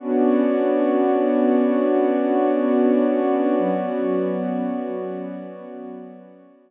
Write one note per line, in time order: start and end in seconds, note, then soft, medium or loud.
0.00 3.54 B3 medium
0.00 6.71 B3 medium
0.00 3.54 C#4 medium
0.00 3.54 D4 medium
0.00 3.54 F#4 medium
0.00 6.71 F#4 medium
0.00 6.71 C#5 medium
0.00 6.71 D5 medium
3.58 6.71 F#3 medium
3.58 6.71 B3 medium
3.58 6.71 C#4 medium
3.58 6.71 F#4 medium